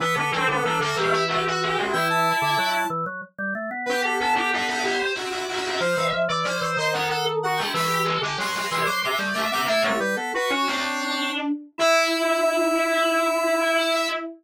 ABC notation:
X:1
M:6/8
L:1/16
Q:3/8=62
K:Em
V:1 name="Lead 1 (square)"
B A A A A A G2 F F F2 | g a5 z6 | B A A A A A G2 F F F2 | c2 z2 d2 ^d f f z f g |
b2 z2 c'2 c' d' d' z d' d' | "^rit." e ^c B A B c5 z2 | e12 |]
V:2 name="Ocarina"
B, B, C B, D F E E G F G E | E6 z6 | G G A G B d c c e d e c | =f e z d c c c A A z ^F E |
G G A G B d c c e d e c | "^rit." E G z2 F F D4 z2 | E12 |]
V:3 name="Drawbar Organ"
E, D, E, D, E, D, E,6 | E,3 D, F,2 E, F, z G, A, B, | B,8 z4 | =F, E, F, E, F, E, ^D,6 |
E,3 D, F,2 E, F, z G, A, B, | "^rit." A, A, G, B, z ^C =C4 z2 | E12 |]